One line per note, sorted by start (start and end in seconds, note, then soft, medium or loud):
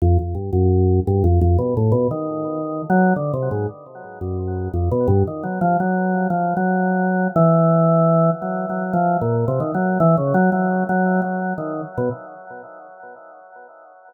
0.02 0.18 F2 loud
0.19 0.35 F2 medium
0.35 0.51 G2 medium
0.53 1.00 F#2 loud
1.07 1.23 G2 loud
1.24 1.40 F2 loud
1.41 1.57 F2 loud
1.58 1.74 B2 medium
1.77 1.93 A2 medium
1.92 2.08 B2 loud
2.11 2.82 D#3 medium
2.90 3.13 F#3 loud
3.16 3.32 D3 medium
3.34 3.49 C3 medium
3.51 3.67 G#2 medium
4.21 4.68 F#2 medium
4.74 4.89 F2 medium
4.91 5.07 B2 loud
5.08 5.23 G2 loud
5.27 5.43 D#3 medium
5.43 5.59 F#3 medium
5.61 5.77 F3 loud
5.80 6.27 F#3 medium
6.30 6.54 F3 medium
6.57 7.28 F#3 medium
7.36 8.30 E3 loud
8.42 8.66 F#3 soft
8.70 8.93 F#3 medium
8.93 9.17 F3 loud
9.21 9.45 A#2 medium
9.48 9.60 C3 loud
9.60 9.72 D#3 medium
9.74 9.98 F#3 medium
10.00 10.16 E3 loud
10.17 10.33 C#3 medium
10.34 10.50 F#3 loud
10.52 10.84 F#3 medium
10.89 11.21 F#3 medium
11.22 11.53 F#3 medium
11.58 11.81 D#3 medium
11.98 12.09 B2 medium